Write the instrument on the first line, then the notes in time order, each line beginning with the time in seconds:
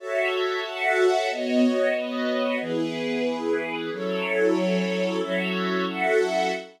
string ensemble 1
0.00 F#4 A4 C#5 E5 A5
0.64 F#4 A4 E5 F#5
1.30 B3 F#4 C#5 D#5
1.94 B3 F#4 B4 D#5
2.61 E3 B3 E4 G#4 B4
3.91 F#3 C#4 E4 A4 C#5
5.20 F#3 C#4 E4 F#4 A4 C#5 E5
5.87 F#4 A4 E5 F#5